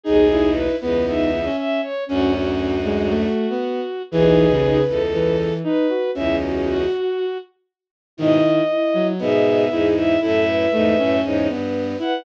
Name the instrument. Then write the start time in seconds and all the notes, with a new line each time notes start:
violin
0.03 B1 D#2 D#4 G#4
0.31 E4
0.53 B4
0.80 C#2 E2 B3 B4
1.06 B3 D#4 E5
1.45 C#4
1.57 E5
1.82 C#5
2.06 D2 F#2 C#4 F#4
2.32 C#4 F#4
2.84 G#3
3.09 A3
3.50 B3
4.11 B1 D#2 E3 G#4 B4
4.51 C#3
4.87 C#2 E2 A4
5.12 E3 B4
5.64 D#4 B4
5.89 F#4
6.15 C#2 E2 C#4 E4 E5
6.41 F#4
6.66 F#4
8.17 G#2 B2 D#3 E4 D#5
8.69 E4
8.94 F#3
9.19 G#2 B2 B3 G#4 E5
9.71 E2 G#2 E4 G#4
9.96 E4 E5
10.21 F#2 A2 E4 A4 E5
10.47 B4
10.72 E2 G#2 A3
10.98 F#2 A2 C#4
11.23 E2 G#2 C#5
11.49 G2 B3 B4
11.99 E4 B4 F#5